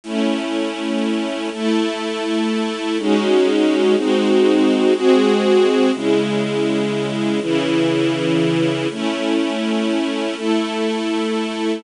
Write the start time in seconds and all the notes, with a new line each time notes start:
0.03 A3 C#4 E4
1.52 A3 E4 A4
2.98 G#3 C#4 D#4 F#4
3.96 G#3 C4 D#4 F#4
4.94 G#3 C4 F#4 G#4
5.94 C#3 G#3 E4
7.41 C#3 E3 E4
8.91 A3 C#4 E4
10.35 A3 E4 A4